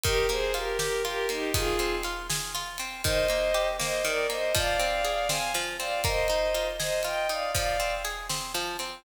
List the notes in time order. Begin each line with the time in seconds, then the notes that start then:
0.03 D#3 G4 A#4, kick, ride
0.29 A#3 G#4 C5, ride
0.54 F4 G4 A#4, ride
0.79 G4 A#4, snare
1.05 F4 G4 A#4, ride
1.29 A#3 D#4 G4, ride
1.54 D#3 F4 G#4, kick, ride
1.79 C4, ride
2.03 F4, ride
2.29 G#4, snare
2.55 F4, ride
2.78 C4, ride
3.04 D#3 C5 D#5, kick, ride
3.28 A#3, ride
3.54 G4, ride
3.79 A#3 C5 D#5, snare
4.04 D#3 A#4 D5, ride
4.30 A#3 C5 D#5, ride
4.54 F3 D5 F5, kick, ride
4.79 C4, ride
5.04 G#4, ride
5.29 C4 F5 G#5, snare
5.54 F3, ride
5.79 C4 D5 F5, ride
6.04 A#3 C5 D#5, kick, ride
6.28 D#4, ride
6.54 F4, ride
6.80 G#4 C5 D#5, snare
7.03 F4 D#5 G5, ride
7.29 D#4 D5 F5, ride
7.54 F3 D5 F5, kick, ride
7.80 C4, ride
8.04 G#4, ride
8.29 C4, snare
8.54 F3, ride
8.79 C4, ride